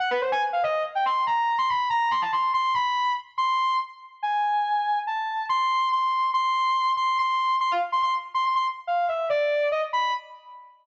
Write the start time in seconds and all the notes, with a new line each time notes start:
0.00 F#5
0.11 B4
0.21 C5
0.32 G#5
0.53 F5
0.63 D#5
0.95 G5
1.06 C6
1.27 A#5
1.58 C6
1.69 B5
1.90 A#5
2.11 C6
2.22 A5
2.32 C6
2.54 C6
2.74 B5
3.38 C6
4.23 G#5
5.07 A5
5.49 C6
5.92 C6
6.34 C6
6.97 C6
7.18 C6
7.61 C6
7.71 F5
7.92 C6
8.03 C6
8.34 C6
8.45 C6
8.56 C6
8.87 F5
9.08 E5
9.30 D5
9.72 D#5
9.93 B5